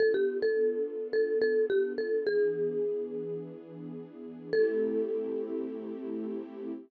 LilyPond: <<
  \new Staff \with { instrumentName = "Marimba" } { \time 4/4 \key a \minor \tempo 4 = 106 a'16 g'8 a'4~ a'16 a'8 a'8 g'8 a'8 | gis'2~ gis'8 r4. | a'1 | }
  \new Staff \with { instrumentName = "String Ensemble 1" } { \time 4/4 \key a \minor <b d' f' a'>1 | <e b d' gis'>1 | <a c' e' g'>1 | }
>>